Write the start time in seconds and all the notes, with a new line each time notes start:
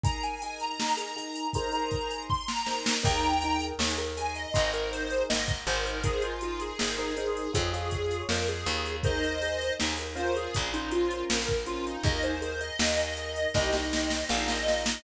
0.03 D#4 G#4 A#4 A#5, kick, closed hi-hat
0.23 G#5, closed hi-hat
0.42 D#4 G#4 A#4 G#5, closed hi-hat
0.60 A#5, closed hi-hat
0.80 D#4 G#4 A#4, snare
0.97 D#4 G#4 A#4, closed hi-hat
1.16 D#4 G#4 A#4, closed hi-hat
1.35 closed hi-hat
1.53 D#4 G#4 A#4 C5 A#5, kick, closed hi-hat
1.72 D#4 G#4 A#4 C5 A#5, closed hi-hat
1.91 kick, closed hi-hat
2.10 closed hi-hat
2.30 C6, kick
2.48 A#5, snare
2.66 D#4 G#4 A#4 C5, snare
2.86 snare
3.03 D#2 D#4 G#4 A#4 G5 A#5, kick, crash
3.23 closed hi-hat
3.42 D#4 G#4 A#4, closed hi-hat
3.60 closed hi-hat
3.79 D#2 D#4 G#4 A#4, snare
3.97 D#4 G#4 A#4, closed hi-hat
4.17 D#4 G#4 A#4 G#5, closed hi-hat
4.35 D#5, closed hi-hat
4.54 G#1 D#4 G#4 A#4 C5, kick, closed hi-hat
4.73 D#4 G#4 A#4 C5, closed hi-hat
4.92 C5, closed hi-hat
5.10 closed hi-hat
5.29 G#1 D#5, snare
5.48 kick, closed hi-hat
5.67 G#1 D#4 G#4 A#4 C5, closed hi-hat
5.85 A#4, closed hi-hat
6.03 D#4 G#4 A#4 C5, kick, closed hi-hat
6.22 F4, closed hi-hat
6.41 D#4 F4 G#4 A#4 C5, closed hi-hat
6.60 G#4, closed hi-hat
6.79 G#1 D#4 G#4 A#4 C5, snare
6.98 D#4 G#4 A#4 C5, closed hi-hat
7.17 D#4 G#4 A#4 C5, closed hi-hat
7.37 closed hi-hat
7.53 F2 F4 G#4 C#5, kick, closed hi-hat
7.73 F4 G#4 C#5, closed hi-hat
7.91 kick, closed hi-hat
8.11 closed hi-hat
8.29 F2 A#4, snare
8.48 G#4, closed hi-hat
8.66 D#2 F4 G#4 C#5, closed hi-hat
8.85 closed hi-hat
9.03 D#4 G#4 A#4 C5 D#5, kick, closed hi-hat
9.23 closed hi-hat
9.42 D#4 G#4 A#4, closed hi-hat
9.61 closed hi-hat
9.80 D#2 D#4 G#4 A#4, snare
9.98 D#4 G#4 A#4, closed hi-hat
10.15 C#4 F4 A#4 C5, closed hi-hat
10.35 G#4, closed hi-hat
10.54 A#1, kick, closed hi-hat
10.73 C#4 D#4 F4 A#4 C5, closed hi-hat
10.91 F4, closed hi-hat
11.11 closed hi-hat
11.29 A#1 A#4, snare
11.48 kick, closed hi-hat
11.66 C#4 F4 A#4 C5, closed hi-hat
11.86 D#4, closed hi-hat
12.03 D#2 D#4 G#4 A#4 D#5, kick, closed hi-hat
12.23 C5, closed hi-hat
12.42 D#4 G#4 A#4 C5, closed hi-hat
12.61 D#5, closed hi-hat
12.79 D#2 D#4 G#4 A#4, snare
12.98 D#4 G#4 A#4, closed hi-hat
13.17 D#4 G#4 A#4, closed hi-hat
13.36 closed hi-hat
13.54 C2 D#4 G4 C5 D#5, kick, snare
13.73 D#4 G4 C5 D#5, snare
13.93 snare
14.10 snare
14.29 A#1 D#4 F4 A#4 F5, snare
14.48 D#5, snare
14.67 D#4 F4 A#4, snare
14.86 snare